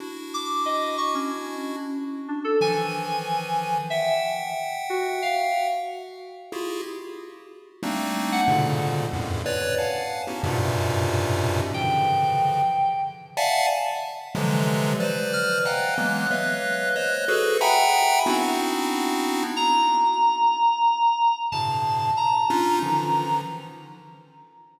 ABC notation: X:1
M:6/4
L:1/16
Q:1/4=92
K:none
V:1 name="Lead 1 (square)"
[DE^F]12 z4 [^D,E,=F,]8 | [e^fg]12 z4 [E=F^FG^G]2 z6 | [G,A,^A,CD^D]4 [^G,,^A,,B,,^C,=D,]4 [E,,F,,^F,,=G,,=A,,]2 [B^cd]2 [=f^f^ga]3 [B,^C^DE^F=G] [F,,G,,^G,,^A,,B,,=C,]8 | [^C,D,E,F,]6 z4 [def^f^ga]2 z4 [=C,D,E,=F,^F,^G,]4 [Bcd]4 |
[^df^fg^g^a]2 [E,^F,^G,^A,B,]2 [B^cde=f]4 [=c^cd]2 [^F^G=AB]2 [e^f=g^g^ab]4 [B,=C=D^DEF]8 | z12 [G,,A,,B,,^C,]4 z2 [^CD^DF]2 [=D,^D,E,F,]4 |]
V:2 name="Electric Piano 2"
z2 d'2 ^d2 ^c' ^C3 z4 =D A ^g6 z2 | e2 z4 ^F2 =f2 z14 | z3 ^f z20 | g8 z14 f'2 |
^f'12 z12 | ^a12 =a4 ^a8 |]